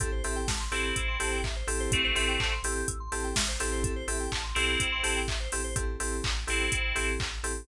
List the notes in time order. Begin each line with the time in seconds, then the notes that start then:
0.00 A1 C4 E4 G4 A4, kick, closed hi-hat
0.12 C5
0.24 A1 C4 E4 G4 A4 E5, open hi-hat
0.36 G5
0.47 A1 A5, kick, snare
0.60 C6
0.72 A1 C4 E4 G4 A4 E6, open hi-hat
0.84 G6
0.96 A1 E6, kick, closed hi-hat
1.08 C6
1.20 A1 C4 E4 G4 A4 A5, open hi-hat
1.32 G5
1.43 A1 E5, kick, clap
1.56 C5
1.67 A1 C4 E4 G4 A4, open hi-hat
1.80 C5
1.91 A1 A3 C4 A4, kick, closed hi-hat
2.04 C5
2.15 A1 C4 E4 G4 A4 E5, open hi-hat
2.28 G5
2.39 A1 A5, kick, clap
2.52 C6
2.63 A1 C4 E4 G4 A4 E6, open hi-hat
2.76 G6
2.88 A1 E6, kick, closed hi-hat
3.00 C6
3.12 A1 C4 E4 G4 A4 A5, open hi-hat
3.24 G5
3.36 A1 E5, kick, snare
3.48 C5
3.60 A1 C4 E4 G4 A4, open hi-hat
3.72 C5
3.82 A1 A4, kick, closed hi-hat
3.96 C5
4.08 A1 C4 E4 G4 A4 E5, open hi-hat
4.20 G5
4.32 A1 A5, kick, clap
4.44 C6
4.55 B1 C4 E4 G4 A4 E6, open hi-hat
4.68 G6
4.80 A1 E6, kick, closed hi-hat
4.92 C6
5.03 A1 C4 E4 G4 A4 A5, open hi-hat
5.16 G5
5.28 A1 E5, kick, clap
5.40 C5
5.52 A1 C4 E4 G4 A4, open hi-hat
5.64 C5
5.76 A1 C4 E4 G4 A4, kick, closed hi-hat
6.00 A1 C4 E4 G4 A4, open hi-hat
6.24 A1, kick, clap
6.47 A1 C4 E4 G4 A4, open hi-hat
6.72 A1, kick, closed hi-hat
6.95 A1 C4 E4 G4 A4, open hi-hat
7.19 A1, kick, clap
7.43 A1 C4 E4 G4 A4, open hi-hat